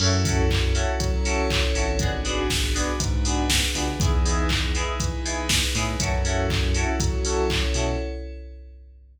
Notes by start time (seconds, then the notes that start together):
0.00 F#2 C#4 E4 F#4 A4, crash
0.25 C#4 E4 F#4 A4, kick, open hi-hat
0.51 kick, clap
0.75 C#4 E4 F#4 A4, open hi-hat
1.00 F#3 C#4 E4 A4 C#5, kick, closed hi-hat
1.25 C#4 E4 F#4 A4, open hi-hat
1.50 kick, clap
1.75 G#1 C#4 E4 F#4 A4, open hi-hat
1.99 B3 D4 F#4 G#4, kick, closed hi-hat
2.25 B3 D4 F#4 G#4, open hi-hat
2.50 kick, snare
2.75 B3 D4 F#4 G#4, open hi-hat
3.00 G#2 B3 D4 G#4 B4, kick, closed hi-hat
3.25 B3 D4 F#4 G#4, open hi-hat
3.50 kick, snare
3.75 C#2 B3 D4 F#4 G#4, open hi-hat
4.00 E2 B3 D#4 E4 G#4, kick, closed hi-hat
4.25 B3 D#4 E4 G#4, open hi-hat
4.49 kick, clap
4.75 B3 D#4 E4 G#4, open hi-hat
5.00 E3 B3 D#4 G#4 B4, kick, closed hi-hat
5.25 B3 D#4 E4 G#4, open hi-hat
5.49 kick, snare
5.75 A2 B3 D#4 E4 G#4, open hi-hat
6.00 F#2 C#4 E4 F#4 A4, kick, closed hi-hat
6.25 C#4 E4 F#4 A4, open hi-hat
6.50 kick, clap
6.74 C#4 E4 F#4 A4, open hi-hat
7.00 F#3 C#4 E4 A4 C#5, kick, closed hi-hat
7.25 C#4 E4 F#4 A4, open hi-hat
7.50 kick, clap
7.74 B2 C#4 E4 F#4 A4, open hi-hat